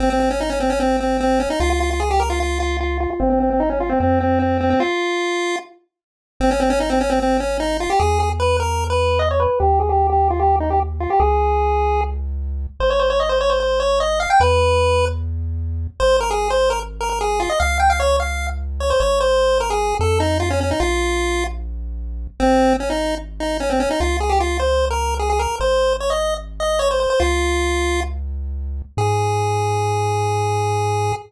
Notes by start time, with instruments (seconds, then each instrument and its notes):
0.00 synth bass 1 G#1, lead 1 (square) C4
0.10 lead 1 (square) C4
0.20 lead 1 (square) C4
0.31 lead 1 (square) C#4
0.40 lead 1 (square) D#4
0.50 lead 1 (square) C#4
0.60 lead 1 (square) C4
0.70 lead 1 (square) C#4
0.80 lead 1 (square) C4
1.00 lead 1 (square) C4
1.20 lead 1 (square) C4
1.40 lead 1 (square) C#4
1.50 lead 1 (square) D#4
1.60 synth bass 1 C#2, lead 1 (square) F4
1.70 lead 1 (square) F4
1.80 lead 1 (square) F4
1.91 lead 1 (square) F4
2.00 lead 1 (square) G#4
2.11 lead 1 (square) G4
2.20 lead 1 (square) A#4
2.30 lead 1 (square) F4
2.40 lead 1 (square) F4
2.60 lead 1 (square) F4
2.81 lead 1 (square) F4
3.00 lead 1 (square) F4
3.10 lead 1 (square) F4
3.20 synth bass 1 G#1, lead 1 (square) C4
3.30 lead 1 (square) C4
3.40 lead 1 (square) C4
3.50 lead 1 (square) C4
3.60 lead 1 (square) D#4
3.70 lead 1 (square) C#4
3.80 lead 1 (square) F4
3.89 lead 1 (square) C4
4.00 synth bass 1 F2, lead 1 (square) C4
4.21 lead 1 (square) C4
4.39 lead 1 (square) C4
4.61 lead 1 (square) C4
4.70 lead 1 (square) C4
4.80 lead 1 (square) F4
6.40 synth bass 1 G#1, lead 1 (square) C4
6.51 lead 1 (square) C#4
6.60 lead 1 (square) C4
6.70 lead 1 (square) C#4
6.80 lead 1 (square) D#4
6.90 lead 1 (square) C4
7.01 lead 1 (square) C#4
7.10 lead 1 (square) C4
7.20 lead 1 (square) C4
7.40 lead 1 (square) C#4
7.60 lead 1 (square) D#4
7.80 lead 1 (square) F4
7.90 lead 1 (square) G4
8.00 synth bass 1 E2, lead 1 (square) G#4
8.20 lead 1 (square) G#4
8.40 lead 1 (square) B4
8.60 lead 1 (square) A#4
8.90 lead 1 (square) B4
9.19 lead 1 (square) D#5
9.31 lead 1 (square) C#5
9.40 lead 1 (square) B4
9.60 synth bass 1 D#2, lead 1 (square) G4
9.80 lead 1 (square) G#4
9.89 lead 1 (square) G4
10.10 lead 1 (square) G4
10.30 lead 1 (square) F4
10.40 lead 1 (square) G4
10.60 lead 1 (square) D#4
10.70 lead 1 (square) G4
11.00 lead 1 (square) F4
11.10 lead 1 (square) G4
11.20 synth bass 1 C#2, lead 1 (square) G#4
12.80 synth bass 1 G#1, lead 1 (square) C5
12.90 lead 1 (square) C#5
13.00 lead 1 (square) C5
13.10 lead 1 (square) C#5
13.20 lead 1 (square) D#5
13.29 lead 1 (square) C5
13.41 lead 1 (square) C#5
13.50 lead 1 (square) C5
13.60 lead 1 (square) C5
13.80 lead 1 (square) C#5
14.00 lead 1 (square) D#5
14.20 lead 1 (square) F5
14.30 lead 1 (square) G5
14.40 synth bass 1 E2, lead 1 (square) B4
16.00 synth bass 1 G#1, lead 1 (square) C5
16.21 lead 1 (square) A#4
16.31 lead 1 (square) G#4
16.50 lead 1 (square) C5
16.70 lead 1 (square) A#4
17.01 lead 1 (square) A#4
17.10 lead 1 (square) A#4
17.21 lead 1 (square) G#4
17.40 lead 1 (square) F4
17.50 lead 1 (square) D#5
17.60 synth bass 1 C#2, lead 1 (square) F5
17.80 lead 1 (square) G5
17.90 lead 1 (square) F5
18.00 lead 1 (square) C#5
18.20 lead 1 (square) F5
18.80 lead 1 (square) C#5
18.90 lead 1 (square) C5
19.00 synth bass 1 G#1, lead 1 (square) C#5
19.21 lead 1 (square) C5
19.60 lead 1 (square) A#4
19.70 lead 1 (square) G#4
20.00 synth bass 1 F2, lead 1 (square) A4
20.20 lead 1 (square) D#4
20.40 lead 1 (square) F4
20.50 lead 1 (square) C#4
20.61 lead 1 (square) C#4
20.71 lead 1 (square) D#4
20.80 synth bass 1 A#1, lead 1 (square) F4
22.40 synth bass 1 G#1, lead 1 (square) C4
22.80 lead 1 (square) C#4
22.90 lead 1 (square) D#4
23.40 lead 1 (square) D#4
23.60 lead 1 (square) C#4
23.70 lead 1 (square) C4
23.80 lead 1 (square) C#4
23.91 lead 1 (square) D#4
24.00 synth bass 1 C#2, lead 1 (square) F4
24.20 lead 1 (square) G#4
24.30 lead 1 (square) G4
24.40 lead 1 (square) F4
24.60 lead 1 (square) C5
24.91 lead 1 (square) A#4
25.19 lead 1 (square) G#4
25.30 lead 1 (square) G#4
25.39 lead 1 (square) A#4
25.60 synth bass 1 G#1, lead 1 (square) C5
26.00 lead 1 (square) C#5
26.10 lead 1 (square) D#5
26.60 lead 1 (square) D#5
26.79 lead 1 (square) C#5
26.91 lead 1 (square) C5
27.00 lead 1 (square) C5
27.10 lead 1 (square) C5
27.20 synth bass 1 C#2, lead 1 (square) F4
28.97 synth bass 1 G#2, lead 1 (square) G#4